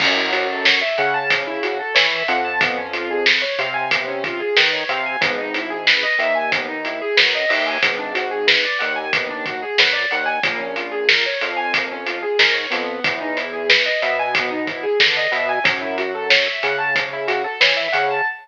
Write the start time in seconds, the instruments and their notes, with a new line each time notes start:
0.00 synth bass 1 F#2, acoustic grand piano C#4, kick, crash
0.17 acoustic grand piano E4
0.32 acoustic grand piano F#4, closed hi-hat
0.50 acoustic grand piano A4
0.65 acoustic grand piano C#5, snare
0.81 acoustic grand piano E5
0.98 synth bass 1 C#3, acoustic grand piano F#5, closed hi-hat
1.14 acoustic grand piano A5
1.30 acoustic grand piano C#4, kick, closed hi-hat
1.47 acoustic grand piano E4
1.63 acoustic grand piano F#4, closed hi-hat
1.79 acoustic grand piano A4
1.95 synth bass 1 E3, acoustic grand piano C#5, snare
2.11 acoustic grand piano E5
2.28 synth bass 1 F2, acoustic grand piano F#5, closed hi-hat
2.45 acoustic grand piano A5
2.61 acoustic grand piano B3, kick, closed hi-hat
2.77 acoustic grand piano C#4
2.93 acoustic grand piano F4, closed hi-hat
3.10 acoustic grand piano G#4
3.26 acoustic grand piano B4, snare
3.42 acoustic grand piano C#5
3.59 synth bass 1 C3, acoustic grand piano F5, closed hi-hat
3.74 acoustic grand piano G#5
3.91 acoustic grand piano B3, kick, closed hi-hat
4.08 acoustic grand piano C#4
4.24 acoustic grand piano F4, kick, closed hi-hat
4.40 acoustic grand piano G#4
4.57 synth bass 1 D#3, acoustic grand piano B4, snare
4.73 acoustic grand piano C#5
4.89 synth bass 1 C3, acoustic grand piano F5, closed hi-hat
5.06 acoustic grand piano G#5
5.21 synth bass 1 G#1, acoustic grand piano B3, kick, closed hi-hat
5.38 acoustic grand piano D#4
5.54 acoustic grand piano E4, closed hi-hat
5.70 acoustic grand piano G#4
5.87 acoustic grand piano B4, snare
6.03 acoustic grand piano D#5
6.19 synth bass 1 D#2, acoustic grand piano E5, closed hi-hat
6.35 acoustic grand piano G#5
6.52 acoustic grand piano B3, kick, closed hi-hat
6.69 acoustic grand piano D#4
6.85 acoustic grand piano E4, closed hi-hat
7.01 acoustic grand piano G#4
7.17 synth bass 1 F#2, acoustic grand piano B4, snare
7.35 acoustic grand piano D#5
7.49 synth bass 1 D#2, acoustic grand piano E5, open hi-hat
7.66 acoustic grand piano G#5
7.83 synth bass 1 G#1, acoustic grand piano B3, kick, closed hi-hat
7.99 acoustic grand piano D4
8.14 acoustic grand piano F#4, closed hi-hat
8.31 acoustic grand piano G#4
8.47 acoustic grand piano B4, snare
8.65 acoustic grand piano D5
8.79 synth bass 1 D#2, acoustic grand piano F#5, closed hi-hat
8.96 acoustic grand piano G#5
9.13 acoustic grand piano B3, kick, closed hi-hat
9.29 acoustic grand piano D4
9.46 acoustic grand piano F#4, kick, closed hi-hat
9.62 acoustic grand piano G#4
9.78 synth bass 1 F#2, acoustic grand piano B4, snare
9.93 acoustic grand piano D5
10.11 synth bass 1 D#2, acoustic grand piano F#5, closed hi-hat
10.26 acoustic grand piano G#5
10.43 synth bass 1 A#1, acoustic grand piano A#3, kick, closed hi-hat
10.59 acoustic grand piano C#4
10.76 acoustic grand piano F4, closed hi-hat
10.92 acoustic grand piano G#4
11.09 acoustic grand piano A#4, snare
11.26 acoustic grand piano C#5
11.41 synth bass 1 F2, acoustic grand piano F5, closed hi-hat
11.57 acoustic grand piano G#5
11.73 acoustic grand piano A#3, kick, closed hi-hat
11.92 acoustic grand piano C#4
12.06 acoustic grand piano F4, closed hi-hat
12.23 acoustic grand piano G#4
12.39 synth bass 1 G#2, acoustic grand piano A#4, snare
12.54 acoustic grand piano C#5
12.70 synth bass 1 F2, acoustic grand piano B3, snare, closed hi-hat
13.04 synth bass 1 E2, kick, closed hi-hat
13.21 acoustic grand piano D#4
13.37 acoustic grand piano E4, closed hi-hat
13.53 acoustic grand piano G#4
13.69 acoustic grand piano B4, snare
13.86 acoustic grand piano D#5
14.02 synth bass 1 B2, acoustic grand piano E5, closed hi-hat
14.19 acoustic grand piano G#5
14.35 acoustic grand piano B3, kick, closed hi-hat
14.51 acoustic grand piano D#4
14.67 acoustic grand piano E4, kick, closed hi-hat
14.83 acoustic grand piano G#4
15.00 synth bass 1 D3, acoustic grand piano B4, snare
15.17 acoustic grand piano D#5
15.32 synth bass 1 B2, acoustic grand piano E5, closed hi-hat
15.49 acoustic grand piano G#5
15.64 synth bass 1 F#2, acoustic grand piano C#4, kick, closed hi-hat
15.82 acoustic grand piano E4
15.98 acoustic grand piano F#4, closed hi-hat
16.15 acoustic grand piano A4
16.30 acoustic grand piano C#5, snare
16.46 acoustic grand piano E5
16.63 synth bass 1 C#3, acoustic grand piano F#5, closed hi-hat
16.78 acoustic grand piano A5
16.96 acoustic grand piano C#4, kick, closed hi-hat
17.13 acoustic grand piano E4
17.28 acoustic grand piano F#4, closed hi-hat
17.44 acoustic grand piano A4
17.60 synth bass 1 E3, acoustic grand piano C#5, snare
17.77 acoustic grand piano E5
17.93 synth bass 1 C#3, acoustic grand piano F#5, closed hi-hat
18.10 acoustic grand piano A5